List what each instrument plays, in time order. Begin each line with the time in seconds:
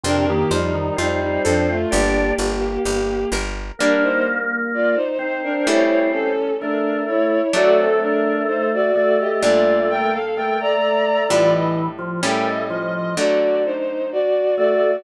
0.04 electric bass (finger) F2, drawbar organ C3, violin D4 A#4, acoustic guitar (steel) F4
0.27 drawbar organ D#3, violin A#3 G4
0.50 electric bass (finger) F2, drawbar organ F3, violin G3 D#4, acoustic guitar (steel) C5
0.74 drawbar organ D#3
0.96 electric bass (finger) F2, violin G3 D#4, drawbar organ C4, acoustic guitar (steel) F4
1.22 violin G3 D#4
1.44 electric bass (finger) F2, violin F3 D4, acoustic guitar (steel) A4
1.69 violin A3 F4
1.91 electric bass (finger) G1, violin A#3 G4, drawbar organ D4, acoustic guitar (steel) G4
2.38 electric bass (finger) G1, acoustic guitar (steel) D5
2.85 electric bass (finger) G1, acoustic guitar (steel) G4
3.32 electric bass (finger) G1, acoustic guitar (steel) A#4
3.79 acoustic guitar (steel) G3 A#3 D4, drawbar organ A#3, violin D4 A#4
4.03 violin D#4 C5
4.74 violin F4 D5
4.95 violin D#4 C5
5.19 drawbar organ C4, violin D#4 C5
5.43 violin D4 A#4
5.67 acoustic guitar (steel) C#3 G3 A3 E4, violin E4 C#5
6.12 violin C#4 A4
6.60 drawbar organ A3, violin D4 A#4
7.07 violin E4 C#5
7.53 acoustic guitar (steel) F#3 A3 D4, drawbar organ A3, violin F#4 D5
7.77 violin C4 A4
8.02 violin D4 A#4
8.47 violin D#4 C5
8.73 violin F#4 D5
8.94 drawbar organ A3, violin F#4 D5
9.19 violin G4 D#5
9.41 acoustic guitar (steel) A#2 G3 D4, violin F4 D5
9.90 violin A#4 G5
10.12 violin A4 F5
10.37 drawbar organ A3, violin A#4 G5
10.60 violin D5 A#5
11.28 acoustic guitar (steel) A2 G3 D4 E4, drawbar organ E3, violin F4 D5
11.52 violin D#5
11.98 drawbar organ F3
12.23 acoustic guitar (steel) A2 G3 C#4 E4, drawbar organ A3, violin A#4 G5
12.47 violin D#5
12.70 drawbar organ F3, violin D#5
12.94 violin D#5
13.17 acoustic guitar (steel) D3 F#3 A3, violin F#4 D5
13.65 violin D#4 C5
14.12 violin F#4 D5
14.56 drawbar organ A3, violin F#4 D5